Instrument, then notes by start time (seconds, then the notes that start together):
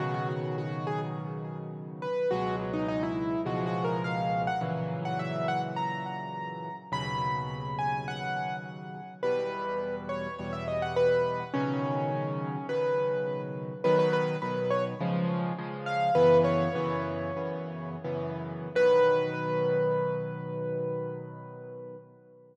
acoustic grand piano
0.00 B2 C#3 D#3 F#3 F#4
0.14 F#4
0.29 F#4
0.58 F#4
0.87 G#4
2.02 B4
2.31 C#2 B2 F#3 G#3 F#4
2.73 D#4
2.88 D#4
3.03 E4
3.45 C#2 B2 F3 G#3 F#4
3.66 F#4
3.84 A#4
4.04 F5
4.47 F#5
4.61 A#2 C#3 E3 F#3
5.05 F#5
5.19 E5
5.48 F#5
5.76 A#5
6.92 D#2 B2 C#3 F#3 B5
7.78 G#5
8.08 F#5
9.23 E2 B2 G3 B4
10.09 C#5
10.38 E2 B2 G3 C#5
10.53 E5
10.68 D#5
10.82 F#5
10.96 B4
11.54 B2 C#3 D#3 F#3 C#4
12.69 B2 C#3 D#3 F#3 B4
13.84 B2 D#3 F#3 B4
13.99 B4
14.13 B4
14.42 B2 D#3 F#3 B4
14.70 C#5
15.00 C#3 F3 G#3
15.58 C#3 F3 G#3
15.86 F5
16.15 F#2 C#3 E3 B3 B4
16.44 C#5
16.75 F#2 C#3 E3 B3
17.37 F#2 C#3 E3 B3
18.04 F#2 C#3 E3 B3
18.75 B2 D#3 F#3 B4